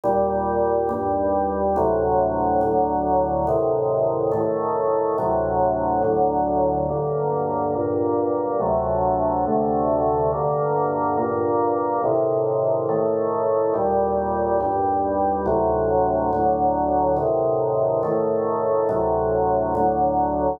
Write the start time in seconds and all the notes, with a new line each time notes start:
0.04 D#2 A#2 G3
0.89 D#2 G2 G3
1.76 D2 A2 C3 F#3
2.61 D2 A2 D3 F#3
3.47 A2 C3 D#3
4.32 A2 D#3 A3
5.18 D2 A2 C3 F#3
6.03 D2 A2 D3 F#3
6.89 G2 D3 A#3
7.75 G2 A#2 A#3
8.60 D2 C3 F#3 A3
9.46 D2 C3 D3 A3
10.33 G2 D3 A#3
11.17 G2 A#2 A#3
12.04 A2 C3 D#3
12.89 A2 D#3 A3
13.74 D#2 A#2 G3
14.61 D#2 G2 G3
15.46 D2 A2 C3 F#3
16.33 D2 A2 D3 F#3
17.17 A2 C3 D#3
18.03 A2 D#3 A3
18.89 D2 A2 C3 F#3
19.75 D2 A2 D3 F#3